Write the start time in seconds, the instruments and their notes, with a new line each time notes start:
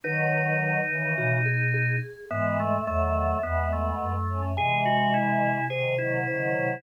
0.04 choir aahs D#3 F#3, flute D#3, drawbar organ D#4, vibraphone B4
0.89 choir aahs C#3 E3, flute D#3
1.17 flute B2, vibraphone F#4
1.46 vibraphone G#4
1.74 vibraphone G#4
2.30 flute G#2, choir aahs E3 G#3, drawbar organ B3, vibraphone E5
2.60 drawbar organ A3
2.87 flute E2, choir aahs D#3 F#3, drawbar organ A3, vibraphone E5
3.42 flute E2, choir aahs G#3 B3, drawbar organ B3
3.73 drawbar organ A3
4.01 flute F#2
4.28 choir aahs A3 C#4
4.57 flute C3, choir aahs E3 G#3, drawbar organ G#4, vibraphone G#5
4.85 drawbar organ F#4
5.14 drawbar organ E4
5.70 choir aahs C3 D#3, drawbar organ G#4, vibraphone C5
5.98 choir aahs D#3 F#3, drawbar organ E4
6.27 flute C#3, choir aahs D#3 F#3, vibraphone C5
6.56 flute C3